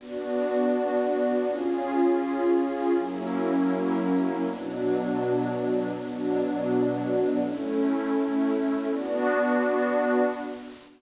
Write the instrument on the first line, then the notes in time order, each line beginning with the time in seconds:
pad 2 (warm)
0.00 B3 D4 F#4 D5
1.47 C#4 F4 G#4
2.96 F#3 A#3 C#4 E4 A#4
4.44 B2 F#3 B3 D4 F#4
5.93 B2 F#3 B3 D4 F#4
7.40 A3 C#4 E4
8.89 B3 D4 F#4 D5